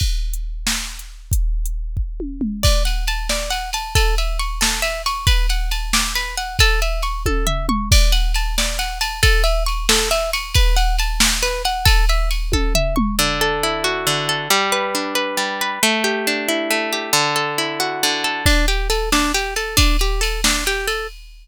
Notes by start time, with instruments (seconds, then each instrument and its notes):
0.00 kick, crash
0.34 closed hi-hat
0.67 snare
0.99 closed hi-hat
1.32 kick, closed hi-hat
1.66 closed hi-hat
1.97 kick
2.20 high tom
2.41 mid tom
2.63 acoustic guitar (steel) D5, kick, crash
2.85 acoustic guitar (steel) F#5, ride
3.07 acoustic guitar (steel) A5, ride
3.29 acoustic guitar (steel) D5, snare
3.50 acoustic guitar (steel) F#5, ride
3.73 acoustic guitar (steel) A5, ride
3.95 acoustic guitar (steel) A4, kick, ride
4.18 acoustic guitar (steel) E5, ride
4.39 acoustic guitar (steel) C#6, ride
4.61 acoustic guitar (steel) A4, snare
4.82 acoustic guitar (steel) E5, ride
5.06 acoustic guitar (steel) C#6, ride
5.27 acoustic guitar (steel) B4, kick, ride
5.49 acoustic guitar (steel) F#5, ride
5.71 acoustic guitar (steel) A5, ride
5.93 acoustic guitar (steel) D6, snare
6.15 acoustic guitar (steel) B4, ride
6.37 acoustic guitar (steel) F#5, ride
6.59 acoustic guitar (steel) A4, kick, ride
6.82 acoustic guitar (steel) E5, ride
7.02 acoustic guitar (steel) C#6, ride
7.26 acoustic guitar (steel) A4, kick, high tom
7.47 acoustic guitar (steel) E5, floor tom
7.69 acoustic guitar (steel) C#6, mid tom
7.91 acoustic guitar (steel) D5, kick, crash
8.12 acoustic guitar (steel) F#5, ride
8.34 acoustic guitar (steel) A5, ride
8.58 acoustic guitar (steel) D5, snare
8.79 acoustic guitar (steel) F#5, ride
9.01 acoustic guitar (steel) A5, ride
9.23 acoustic guitar (steel) A4, kick, ride
9.44 acoustic guitar (steel) E5, ride
9.66 acoustic guitar (steel) C#6, ride
9.89 acoustic guitar (steel) A4, snare
10.11 acoustic guitar (steel) E5, ride
10.33 acoustic guitar (steel) C#6, ride
10.54 acoustic guitar (steel) B4, kick, ride
10.76 acoustic guitar (steel) F#5, ride
10.99 acoustic guitar (steel) A5, ride
11.20 acoustic guitar (steel) D6, snare
11.42 acoustic guitar (steel) B4, ride
11.65 acoustic guitar (steel) F#5, ride
11.85 acoustic guitar (steel) A4, kick, ride
12.09 acoustic guitar (steel) E5, ride
12.31 acoustic guitar (steel) C#6, ride
12.52 acoustic guitar (steel) A4, kick, high tom
12.75 acoustic guitar (steel) E5, floor tom
12.96 acoustic guitar (steel) C#6, mid tom
13.19 acoustic guitar (steel) D3
13.41 acoustic guitar (steel) A4
13.63 acoustic guitar (steel) E4
13.84 acoustic guitar (steel) F#4
14.07 acoustic guitar (steel) D3
14.29 acoustic guitar (steel) A4
14.50 acoustic guitar (steel) G3
14.72 acoustic guitar (steel) B4
14.95 acoustic guitar (steel) D4
15.15 acoustic guitar (steel) B4
15.37 acoustic guitar (steel) G3
15.61 acoustic guitar (steel) B4
15.83 acoustic guitar (steel) A3
16.04 acoustic guitar (steel) G4
16.27 acoustic guitar (steel) D4
16.48 acoustic guitar (steel) E4
16.71 acoustic guitar (steel) A3
16.92 acoustic guitar (steel) G4
17.13 acoustic guitar (steel) D3
17.36 acoustic guitar (steel) A4
17.58 acoustic guitar (steel) E4
17.80 acoustic guitar (steel) F#4
18.03 acoustic guitar (steel) D3
18.24 acoustic guitar (steel) A4
18.46 acoustic guitar (steel) D4, kick, crash
18.68 acoustic guitar (steel) G4, ride
18.90 acoustic guitar (steel) A4, ride
19.12 acoustic guitar (steel) D4, snare
19.34 acoustic guitar (steel) G4, ride
19.56 acoustic guitar (steel) A4, ride
19.77 acoustic guitar (steel) D4, kick, ride
19.99 acoustic guitar (steel) G4, ride
20.21 acoustic guitar (steel) A4, ride
20.44 acoustic guitar (steel) D4, snare
20.66 acoustic guitar (steel) G4, ride
20.87 acoustic guitar (steel) A4, ride